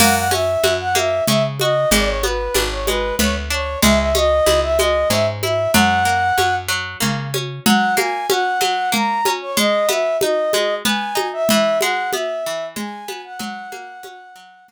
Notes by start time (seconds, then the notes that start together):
0.00 F#2 A#3 F#5, crash, low conga
0.16 F#5
0.31 C#4 E5, high conga
0.64 F#2 F#4, high conga
0.80 F#5
0.95 A#3 E5, high conga
1.28 C#3 C#4 E5, low conga
1.59 F#4 D#5, high conga
1.91 G#1 G#3 D5, low conga
2.08 C#5
2.23 B3 B4, high conga
2.54 G#1 D4, high conga
2.71 C#5
2.87 G#3 B4, high conga
3.19 D2 B3 C#5, low conga
3.50 D4 C#5
3.82 C#2 G#3 E5, low conga
3.99 E5
4.15 C#4 D#5, high conga
4.46 C#2 E4, high conga
4.63 E5
4.79 G#3 D#5, high conga
5.10 G#2 C#4 E5, low conga
5.43 E4 E5, high conga
5.74 F#2 F#3 F#5, low conga
6.05 A#3
6.38 F#2 C#4, high conga
6.68 F#3
7.00 C#3 A#3, low conga
7.34 C#4, high conga
7.66 F#3 F#5, low conga
7.97 A#3 G#5, high conga
8.30 C#4 F#5, high conga
8.61 F#3, high conga
8.92 A#3 A#5, low conga
9.25 C#4, high conga
9.41 C#5
9.57 G#3 D#5, low conga
9.89 B3 E5, high conga
10.21 D#4 D#5, high conga
10.53 G#3, high conga
10.85 B3 G#5, low conga
11.15 D#4, high conga
11.33 E5
11.49 E3 E5, low conga
11.81 G#3 F#5, high conga
12.13 B3 E5, high conga
12.46 E3
12.76 G#3 G#5, low conga
13.08 B3, high conga
13.24 F#5
13.39 F#3 F#5, low conga
13.72 A#3, high conga
14.03 C#4, high conga
14.36 F#3
14.68 A#3, low conga